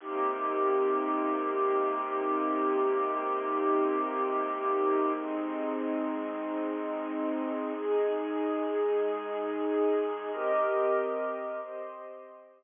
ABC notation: X:1
M:4/4
L:1/8
Q:"Swing 16ths" 1/4=93
K:Cm
V:1 name="String Ensemble 1"
[C,B,EG]8- | [C,B,EG]8 | [A,CE]8 | [A,EA]8 |
[CGBe]4 [CGce]4 |]